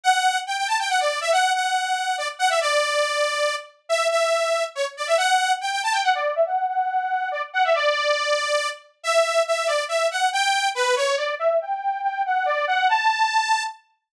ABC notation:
X:1
M:3/4
L:1/16
Q:1/4=140
K:Amix
V:1 name="Lead 2 (sawtooth)"
f4 g g a g f d2 e | f2 f6 d z f e | d10 z2 | e2 e6 c z d e |
f4 g g a g f d2 e | f2 f6 d z f e | d10 z2 | e4 e2 d2 e2 f2 |
g4 B2 c2 d2 e2 | g4 g2 f2 d2 f2 | a8 z4 |]